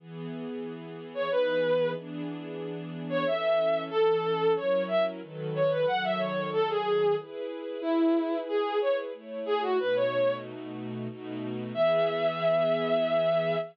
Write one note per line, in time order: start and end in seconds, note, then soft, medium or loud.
0.00 1.29 E3 medium
0.00 1.29 B3 medium
0.00 1.29 G#4 medium
1.14 1.30 C#5 medium
1.30 1.95 E3 medium
1.30 1.95 B3 medium
1.30 1.95 D#4 medium
1.30 1.95 G#4 medium
1.30 1.90 B4 medium
1.96 3.25 E3 medium
1.96 3.25 B3 medium
1.96 3.25 D4 medium
1.96 3.25 G#4 medium
3.10 3.25 C#5 loud
3.25 3.90 E3 medium
3.25 3.90 C#4 medium
3.25 3.90 A4 medium
3.25 3.82 E5 medium
3.90 4.56 E3 medium
3.90 4.56 C#4 medium
3.90 4.52 A4 loud
3.90 4.56 A4 medium
4.56 5.21 F#3 medium
4.56 5.21 C#4 medium
4.56 5.21 E4 medium
4.56 5.21 A#4 medium
4.56 4.83 C#5 medium
4.88 5.03 E5 medium
5.21 5.86 D#3 medium
5.21 5.86 F#3 medium
5.21 5.86 A4 medium
5.21 5.86 B4 medium
5.55 5.70 C#5 medium
5.71 5.86 B4 medium
5.87 7.16 D#3 medium
5.87 7.16 F#3 medium
5.87 7.16 A4 medium
5.87 6.03 F#5 loud
6.04 6.19 E5 loud
6.19 6.50 C#5 medium
6.53 6.69 A4 loud
6.69 7.15 G#4 loud
7.18 7.82 E4 medium
7.18 7.82 G#4 medium
7.18 7.82 B4 medium
7.81 8.38 E4 loud
7.81 9.12 E4 medium
7.81 9.12 G#4 medium
7.81 9.12 B4 medium
8.48 8.79 G#4 medium
8.81 8.97 C#5 medium
9.13 9.78 A3 medium
9.13 9.78 E4 medium
9.13 9.78 C#5 medium
9.46 9.61 G#4 loud
9.62 9.78 F#4 loud
9.79 11.08 B2 medium
9.79 11.08 A3 medium
9.79 11.08 D#4 medium
9.79 11.08 F#4 medium
9.79 9.95 B4 medium
9.95 10.35 C#5 medium
11.08 11.73 B2 medium
11.08 11.73 A3 medium
11.08 11.73 D#4 medium
11.08 11.73 F#4 medium
11.74 13.56 E3 medium
11.74 13.56 B3 loud
11.74 13.56 G#4 loud
11.74 13.56 E5 loud